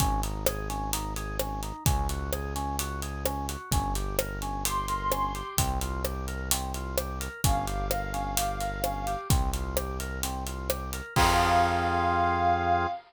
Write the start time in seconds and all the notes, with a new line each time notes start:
0.00 G#1 C#4, kick, closed hi-hat
0.23 D#4, closed hi-hat
0.46 G#4, cross-stick
0.69 C#4, closed hi-hat
0.93 D#4, closed hi-hat
1.16 G#4, closed hi-hat
1.39 C#4, cross-stick
1.63 D#4, closed hi-hat
1.85 C#2 C#4, kick, closed hi-hat
2.09 F#4, closed hi-hat
2.33 G#4, cross-stick
2.56 C#4, closed hi-hat
2.79 F#4, closed hi-hat
3.02 G#4, closed hi-hat
3.25 C#4, cross-stick
3.49 F#4, closed hi-hat
3.71 G1 C#4, kick, closed hi-hat
3.95 G4, closed hi-hat
4.19 A#4, cross-stick
4.42 C#4, closed hi-hat
4.64 G4 C6, closed hi-hat
4.88 A#4, closed hi-hat
5.12 C#4, cross-stick
5.35 G4, closed hi-hat
5.57 C2 C4, kick, closed hi-hat
5.81 F4, closed hi-hat
6.05 G4, cross-stick
6.28 A#4, closed hi-hat
6.51 C4, closed hi-hat
6.74 F4, closed hi-hat
6.98 G4, cross-stick
7.20 A#4, closed hi-hat
7.44 G1 C#4 F5, kick, closed hi-hat
7.67 G4, closed hi-hat
7.91 A#4, cross-stick
8.13 C#4, closed hi-hat
8.37 G4, closed hi-hat
8.60 A#4, closed hi-hat
8.84 C#4, cross-stick
9.07 G4, closed hi-hat
9.30 C2 C4, kick, closed hi-hat
9.53 F4, closed hi-hat
9.77 G4, cross-stick
10.00 A#4, closed hi-hat
10.23 C4, closed hi-hat
10.47 F4, closed hi-hat
10.70 G4, cross-stick
10.93 A#4, closed hi-hat
11.16 F2 C4 F4 G#4 F5, kick, crash